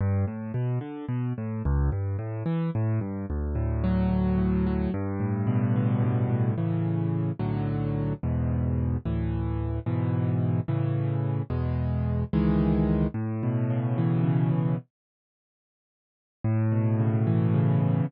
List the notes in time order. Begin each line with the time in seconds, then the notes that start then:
0.01 G2
0.27 A2
0.54 B2
0.81 D3
1.08 B2
1.38 A2
1.65 C#2
1.92 G2
2.19 A2
2.46 E3
2.75 A2
3.01 G2
3.30 D2
3.55 A2
3.84 F#3
4.09 D2
4.38 A2
4.66 F#3
4.94 G2
5.20 A2
5.47 B2
5.76 D3
6.03 G2
6.30 A2
6.58 A2 C#3 E3
7.39 B1 A2 D3 F#3
8.23 E2 G#2 B2
9.05 D2 A2 E3
9.86 G#2 B2 E3
10.68 A2 C#3 E3
11.50 E2 B2 G#3
12.33 C#2 D#3 E3 G#3
13.14 A2
13.43 B2
13.70 C#3
13.98 E3
14.24 C#3
14.52 B2
16.44 A2
16.72 B2
16.99 C#3
17.27 E3
17.54 C#3
17.80 B2